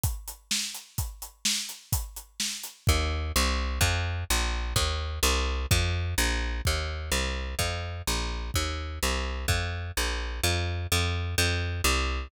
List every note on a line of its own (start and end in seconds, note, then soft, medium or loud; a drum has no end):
0.03 kick loud
0.03 closed hi-hat loud
0.28 closed hi-hat medium
0.51 snare loud
0.74 closed hi-hat medium
0.98 kick loud
0.98 closed hi-hat medium
1.22 closed hi-hat medium
1.45 snare loud
1.69 closed hi-hat medium
1.92 kick loud
1.92 closed hi-hat loud
2.16 closed hi-hat medium
2.40 snare loud
2.64 closed hi-hat medium
2.87 3.32 D#2 loud
2.87 kick loud
3.36 3.79 C2 loud
3.81 4.24 F2 loud
3.81 kick loud
4.30 4.74 A#1 loud
4.76 5.19 D#2 medium
4.76 kick loud
5.23 5.66 C2 loud
5.71 6.15 F2 loud
5.71 kick loud
6.18 6.61 A#1 loud
6.65 7.10 D#2 medium
6.65 kick loud
7.12 7.55 C2 medium
7.59 8.02 F2 medium
7.59 kick medium
8.07 8.51 A#1 medium
8.54 8.99 D#2 medium
8.54 kick medium
9.03 9.46 C2 medium
9.48 9.92 F2 medium
9.48 kick loud
9.97 10.41 A#1 medium
10.43 10.87 F2 loud
10.92 11.35 F2 loud
11.38 11.81 F2 loud
11.84 12.28 C2 loud